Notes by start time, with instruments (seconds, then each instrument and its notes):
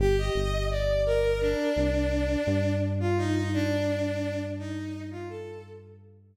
0.00 synth bass 1 G1, violin G4
0.18 violin D#5
0.35 synth bass 1 G1
0.71 violin D5
1.06 violin A#4
1.41 violin D4
1.76 synth bass 1 C2
2.47 synth bass 1 G2
3.00 violin F4
3.17 violin D#4
3.34 violin D#4
3.54 violin D4
4.59 violin D#4
5.11 violin F4
5.29 violin A4